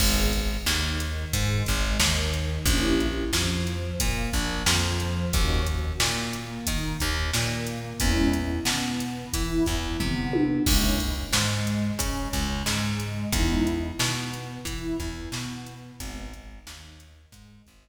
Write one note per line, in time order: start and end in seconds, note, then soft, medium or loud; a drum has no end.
0.00 0.57 G#1 loud
0.00 0.28 B3 medium
0.00 0.28 D#4 medium
0.00 0.28 G#4 medium
0.00 kick loud
0.00 crash loud
0.33 kick medium
0.33 closed hi-hat medium
0.66 1.25 D#2 loud
0.66 1.26 D#3 loud
0.66 snare loud
1.00 closed hi-hat medium
1.33 1.63 G#2 loud
1.33 1.63 G#3 loud
1.33 kick medium
1.33 closed hi-hat loud
1.66 1.98 G#1 loud
1.66 1.96 G#3 loud
1.66 kick medium
1.66 closed hi-hat medium
2.00 2.59 D#2 loud
2.00 2.59 D#3 loud
2.00 snare loud
2.33 closed hi-hat medium
2.66 3.24 A#1 loud
2.66 2.95 A#3 medium
2.66 2.95 C#4 medium
2.66 2.95 E4 medium
2.66 2.95 G4 medium
2.66 kick loud
2.66 closed hi-hat loud
3.00 closed hi-hat medium
3.33 3.92 F2 medium
3.33 3.93 F3 medium
3.33 snare loud
3.67 closed hi-hat medium
4.00 4.30 A#2 loud
4.00 4.30 A#3 loud
4.00 kick medium
4.00 closed hi-hat loud
4.33 4.63 A#1 loud
4.33 4.63 A#3 medium
4.33 kick medium
4.33 snare soft
4.33 closed hi-hat medium
4.66 5.25 F2 loud
4.66 5.26 F3 loud
4.66 snare loud
5.00 closed hi-hat medium
5.33 5.93 D#2 loud
5.33 5.62 A#3 medium
5.33 5.62 C#4 medium
5.33 5.62 D#4 medium
5.33 5.62 F#4 medium
5.33 kick loud
5.33 closed hi-hat loud
5.67 kick medium
5.67 closed hi-hat medium
6.00 6.59 A#2 medium
6.00 6.59 A#3 medium
6.00 snare loud
6.33 closed hi-hat medium
6.67 6.97 D#3 loud
6.67 6.96 D#4 medium
6.67 kick medium
6.67 closed hi-hat loud
7.00 7.31 D#2 loud
7.00 7.29 D#3 loud
7.00 kick medium
7.00 closed hi-hat medium
7.33 7.93 A#2 loud
7.33 7.93 A#3 medium
7.33 snare loud
7.67 closed hi-hat medium
8.00 8.60 E2 loud
8.00 8.28 G#3 medium
8.00 8.28 B3 medium
8.00 8.28 C#4 medium
8.00 8.28 E4 medium
8.00 kick loud
8.00 closed hi-hat loud
8.33 closed hi-hat medium
8.65 9.24 B2 medium
8.65 9.26 B3 medium
8.65 snare loud
9.00 closed hi-hat medium
9.33 9.63 E3 loud
9.33 9.63 E4 medium
9.33 kick medium
9.33 closed hi-hat loud
9.66 9.97 E2 medium
9.66 9.96 E3 medium
9.66 kick medium
9.66 closed hi-hat medium
10.00 10.59 C3 loud
10.00 10.59 B3 medium
10.00 kick medium
10.00 floor tom medium
10.33 high tom loud
10.66 11.26 C#2 loud
10.66 10.94 G#3 medium
10.66 10.94 A#3 medium
10.66 10.94 C#4 medium
10.66 10.94 E4 medium
10.66 kick loud
10.66 crash loud
11.00 kick medium
11.00 closed hi-hat medium
11.33 11.92 G#2 medium
11.33 11.93 G#3 medium
11.33 snare loud
11.67 closed hi-hat medium
11.99 12.28 C#3 medium
11.99 12.29 C#4 medium
11.99 kick medium
11.99 closed hi-hat loud
12.33 12.63 C#2 loud
12.33 12.63 C#3 medium
12.33 kick medium
12.33 closed hi-hat medium
12.66 13.25 G#2 loud
12.66 13.26 G#3 medium
12.66 snare loud
13.00 closed hi-hat medium
13.32 13.91 E2 loud
13.32 13.62 G#3 medium
13.32 13.62 B3 medium
13.32 13.62 D#4 medium
13.32 13.62 E4 medium
13.32 kick loud
13.32 closed hi-hat loud
13.67 closed hi-hat medium
13.99 14.58 B2 loud
13.99 14.59 B3 medium
13.99 snare loud
14.34 closed hi-hat medium
14.65 14.95 E3 loud
14.65 14.96 E4 medium
14.65 kick medium
14.65 closed hi-hat loud
15.00 15.29 E2 medium
15.00 15.30 E3 medium
15.00 kick medium
15.00 closed hi-hat medium
15.32 15.91 B2 medium
15.32 15.92 B3 medium
15.32 snare loud
15.67 closed hi-hat medium
16.00 16.59 G#1 loud
16.00 16.28 G#3 medium
16.00 16.28 B3 medium
16.00 16.28 D#4 medium
16.00 kick loud
16.00 closed hi-hat loud
16.33 kick medium
16.33 closed hi-hat medium
16.67 17.26 D#2 loud
16.67 17.26 D#3 medium
16.67 snare loud
17.00 closed hi-hat medium
17.32 17.62 G#2 loud
17.32 17.63 G#3 medium
17.32 kick medium
17.32 closed hi-hat medium
17.67 17.88 G#1 loud
17.67 17.88 G#3 loud
17.67 kick medium
17.67 closed hi-hat medium